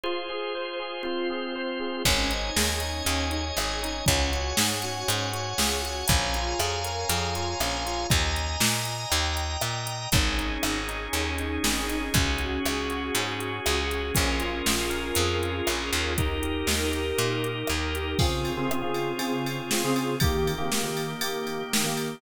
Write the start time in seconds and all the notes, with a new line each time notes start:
0.03 F4 G#4 C5
0.30 G#4
0.55 C5
0.80 G#4
1.03 C4 F4 C5
1.30 G#4
1.56 C5
1.80 G#4
2.05 G#1 C#4 C#5 D#5 G#5, kick, crash
2.31 D#4, closed hi-hat
2.56 D#2 G#4, snare
2.80 D#4, closed hi-hat
3.05 D#2 C#4, closed hi-hat
3.31 D#4, closed hi-hat
3.57 G#1 G#4, cross-stick
3.83 D#4, closed hi-hat
4.06 C#2 C#4 C#5 F#5 G#5, kick, closed hi-hat
4.32 F#4, closed hi-hat
4.56 G#2 G#4, snare
4.82 F#4, closed hi-hat
5.08 G#2 C#4, closed hi-hat
5.33 F#4, closed hi-hat
5.58 C#2 G#4, snare
5.82 F#4, closed hi-hat
6.07 A#1 C#4 C#5 F5 G#5 A#5, kick, closed hi-hat
6.34 F4, closed hi-hat
6.59 F2 G#4, cross-stick
6.84 A#4, closed hi-hat
7.09 F2 G#4, closed hi-hat
7.35 F4, closed hi-hat
7.60 A#1 C#4, cross-stick
7.86 F4, closed hi-hat
8.10 D#2 D#5 G#5 A#5, kick, closed hi-hat
8.36 closed hi-hat
8.60 A#2, snare
8.85 closed hi-hat
9.10 D#2 D#5 G5 A#5, closed hi-hat
9.37 closed hi-hat
9.61 A#2, cross-stick
9.87 closed hi-hat
10.12 G#1 C#4 D#4 G#4, kick, closed hi-hat
10.38 D#4, closed hi-hat
10.62 G#1 G#4, cross-stick
10.89 D#4, closed hi-hat
11.13 D#2 C#4, closed hi-hat
11.38 D#4, closed hi-hat
11.63 G#1 G#4, snare
11.89 D#4, closed hi-hat
12.14 C#2 C#4 F#4 G#4, kick, closed hi-hat
12.38 F#4, closed hi-hat
12.65 C#2 G#4, cross-stick
12.90 F#4, closed hi-hat
13.15 G#2 C#4, closed hi-hat
13.39 F#4, closed hi-hat
13.66 C#2 G#4, cross-stick
13.91 F#4, closed hi-hat
14.14 A#1 C#4 F4 G#4 A#4, kick, closed hi-hat
14.39 F4, closed hi-hat
14.65 A#1 G#4, snare
14.90 A#4, closed hi-hat
15.15 F2 G#4, closed hi-hat
15.43 F4, closed hi-hat
15.67 A#1 C#4, cross-stick
15.92 D#2 F4, closed hi-hat
16.18 D#4 G4 A#4, kick, closed hi-hat
16.43 G4, closed hi-hat
16.67 D#2 A#4, snare
16.91 G4, closed hi-hat
17.18 A#2 D#4, closed hi-hat
17.43 G4, closed hi-hat
17.67 D#2 A#4, cross-stick
17.94 G4, closed hi-hat
18.19 C#3 C4 F4 G#4, kick, crash
18.45 ride
18.57 C#3 C4 F4 G#4
18.69 C#3 C4 F4 G#4, cross-stick
18.82 C#3 C4 F4 G#4
18.94 ride
19.19 C#3 C4 F4 G#4, ride
19.46 ride
19.71 C#3 C4 F4 G#4, snare
19.84 C#3 C4 F4 G#4
19.96 ride
20.20 D#3 A#3 G4, kick, ride
20.47 ride
20.58 D#3 A#3 G4
20.72 D#3 A#3 G4, snare
20.83 D#3 A#3 G4
20.97 ride
21.21 D#3 A#3 G4, ride
21.47 ride
21.73 D#3 A#3 G4, snare
21.84 D#3 A#3 G4
21.97 ride